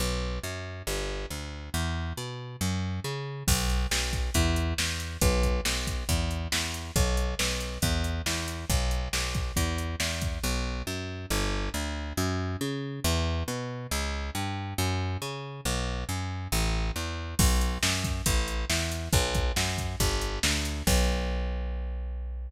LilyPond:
<<
  \new Staff \with { instrumentName = "Electric Bass (finger)" } { \clef bass \time 4/4 \key b \minor \tempo 4 = 138 b,,4 fis,4 g,,4 d,4 | e,4 b,4 fis,4 cis4 | b,,4 b,,4 e,4 e,4 | b,,4 b,,4 e,4 e,4 |
b,,4 b,,4 e,4 e,4 | b,,4 b,,4 e,4 e,4 | b,,4 fis,4 g,,4 d,4 | fis,4 cis4 e,4 b,4 |
cis,4 g,4 fis,4 cis4 | b,,4 fis,4 a,,4 e,4 | b,,4 fis,4 a,,4 e,4 | b,,4 fis,4 g,,4 d,4 |
b,,1 | }
  \new DrumStaff \with { instrumentName = "Drums" } \drummode { \time 4/4 r4 r4 r4 r4 | r4 r4 r4 r4 | <cymc bd>8 hh8 sn8 <hh bd>8 <hh bd>8 hh8 sn8 hh8 | <hh bd>8 <hh bd>8 sn8 <hh bd>8 <hh bd>8 hh8 sn8 hh8 |
<hh bd>8 hh8 sn8 hh8 <hh bd>8 hh8 sn8 hh8 | <hh bd>8 hh8 sn8 <hh bd>8 <hh bd>8 hh8 sn8 <hh bd>8 | r4 r4 r4 r4 | r4 r4 r4 r4 |
r4 r4 r4 r4 | r4 r4 r4 r4 | <cymc bd>8 hh8 sn8 <hh bd>8 <hh bd>8 hh8 sn8 hh8 | <hh bd>8 <hh bd>8 sn8 <hh bd>8 <hh bd>8 hh8 sn8 hh8 |
<cymc bd>4 r4 r4 r4 | }
>>